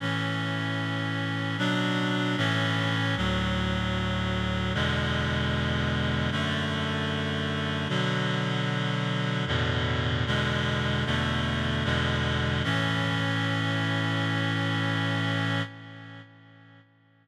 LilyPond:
\new Staff { \time 4/4 \key a \major \tempo 4 = 76 <a, e cis'>2 <b, fis d'>4 <a, e cis'>4 | <d, a, fis>2 <e, b, d gis>2 | <fis, d a>2 <b, d fis>2 | <e, a, b, d>4 <e, b, d gis>4 <e, b, d a>4 <e, b, d gis>4 |
<a, e cis'>1 | }